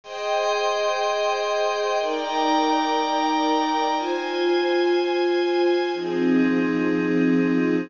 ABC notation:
X:1
M:4/4
L:1/8
Q:1/4=122
K:Fm
V:1 name="String Ensemble 1"
[Aceg]8 | [EB=dg]8 | [Fca]8 | [F,CEA]8 |]
V:2 name="Pad 5 (bowed)"
[Aegc']8 | [E=dgb]8 | [Fca]8 | [F,CEA]8 |]